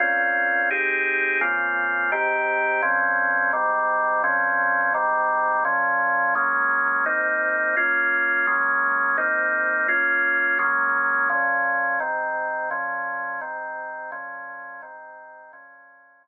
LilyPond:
\new Staff { \time 12/8 \key bes \minor \tempo 4. = 170 <bes, c' des' f'>2. <c' ees' g' aes'>2. | <des bes c' f'>2. <aes, ees c' g'>2. | <bes, f c' des'>2. <aes, ees g c'>2. | <bes, f c' des'>2. <aes, ees g c'>2. |
<bes, f des'>2. <ges aes bes des'>2. | <aes, bes c' ees'>2. <bes des' f'>2. | <ges aes bes des'>2. <aes, bes c' ees'>2. | <bes des' f'>2. <ges aes bes des'>2. |
<bes, f des'>2. <aes, ees c'>2. | <bes, f des'>2. <aes, ees c'>2. | <bes, f des'>2. <aes, ees c'>2. | <bes, f des'>2. <bes, f des'>2. | }